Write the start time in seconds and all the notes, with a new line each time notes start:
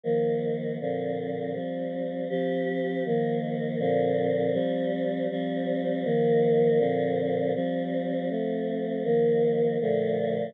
0.03 D#3 F3 A#3
0.80 A#2 D3 F3 C4
1.54 F3 G3 C4
2.29 F3 C4 G4
3.05 D#3 F3 A#3
3.79 A#2 D3 F3 C4
4.53 F3 G3 C4
5.30 F3 G3 C4
6.04 D#3 F3 A#3
6.78 A#2 D3 F3 C4
7.55 F3 G3 C4
8.30 F3 A3 C4
9.04 D#3 F3 A#3
9.81 A#2 D3 F3 A3